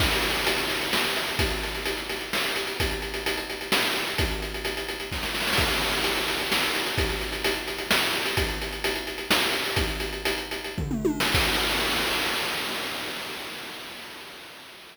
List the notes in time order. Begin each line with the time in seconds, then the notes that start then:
0.00 kick, crash
0.12 closed hi-hat
0.22 closed hi-hat
0.35 closed hi-hat
0.47 closed hi-hat
0.58 closed hi-hat
0.70 closed hi-hat
0.81 closed hi-hat
0.93 snare
1.04 closed hi-hat
1.16 closed hi-hat
1.28 closed hi-hat
1.39 kick, closed hi-hat
1.51 closed hi-hat
1.63 closed hi-hat
1.75 closed hi-hat
1.85 closed hi-hat
1.97 closed hi-hat
2.09 closed hi-hat
2.21 closed hi-hat
2.33 snare
2.44 closed hi-hat
2.56 closed hi-hat
2.67 closed hi-hat
2.80 kick, closed hi-hat
2.91 closed hi-hat
3.02 closed hi-hat
3.14 closed hi-hat
3.26 closed hi-hat
3.37 closed hi-hat
3.50 closed hi-hat
3.61 closed hi-hat
3.72 snare
3.83 closed hi-hat
3.95 closed hi-hat
4.07 closed hi-hat
4.18 kick, closed hi-hat
4.31 closed hi-hat
4.42 closed hi-hat
4.54 closed hi-hat
4.65 closed hi-hat
4.77 closed hi-hat
4.88 closed hi-hat
5.00 closed hi-hat
5.12 kick, snare
5.23 snare
5.34 snare
5.40 snare
5.47 snare
5.53 snare
5.57 kick, crash
5.70 closed hi-hat
5.81 closed hi-hat
5.93 closed hi-hat
6.04 closed hi-hat
6.16 closed hi-hat
6.28 closed hi-hat
6.40 closed hi-hat
6.52 snare
6.63 closed hi-hat
6.75 closed hi-hat
6.87 closed hi-hat
6.98 kick, closed hi-hat
7.09 closed hi-hat
7.21 closed hi-hat
7.32 closed hi-hat
7.44 closed hi-hat
7.56 closed hi-hat
7.68 closed hi-hat
7.78 closed hi-hat
7.91 snare
8.02 closed hi-hat
8.13 closed hi-hat
8.25 closed hi-hat
8.37 kick, closed hi-hat
8.48 closed hi-hat
8.62 closed hi-hat
8.72 closed hi-hat
8.84 closed hi-hat
8.96 closed hi-hat
9.07 closed hi-hat
9.18 closed hi-hat
9.31 snare
9.42 closed hi-hat
9.53 closed hi-hat
9.65 closed hi-hat
9.76 kick, closed hi-hat
9.88 closed hi-hat
10.00 closed hi-hat
10.13 closed hi-hat
10.25 closed hi-hat
10.38 closed hi-hat
10.51 closed hi-hat
10.64 closed hi-hat
10.78 kick, floor tom
10.91 mid tom
11.05 high tom
11.20 snare
11.34 kick, crash